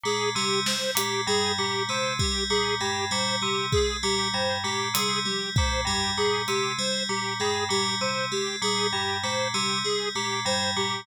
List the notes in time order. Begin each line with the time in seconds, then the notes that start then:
0.04 A#2 G#3 G#4, clap
0.35 C3 G3 G4, clap
0.66 G3 C5, snare
0.95 A#2 G#3 G4, closed hi-hat
1.27 G2 G3 G#4
1.58 A#2 G3 G4
1.89 C3 G#3 C5
2.19 G3 G4, kick
2.50 A#2 G3 G#4
2.80 G2 G#3 G4
3.11 A#2 G3 C5
3.42 C3 G3 G4
3.72 G#3 G#4, kick
4.03 A#2 G3 G4
4.33 G2 G3 C5
4.64 A#2 G#3 G4
4.94 C3 G3 G#4, closed hi-hat
5.25 G3 G4, high tom
5.56 A#2 G#3 C5, kick
5.85 G2 G3 G4, floor tom
6.17 A#2 G3 G#4
6.48 C3 G#3 G4, closed hi-hat
6.79 G3 C5
7.09 A#2 G3 G4
7.40 G2 G#3 G#4
7.69 A#2 G3 G4
8.01 C3 G3 C5
8.32 G#3 G4
8.62 A#2 G3 G#4
8.93 G2 G3 G4
9.23 A#2 G#3 C5
9.54 C3 G3 G4
9.84 G3 G#4
10.15 A#2 G#3 G4
10.45 G2 G3 C5
10.77 A#2 G3 G4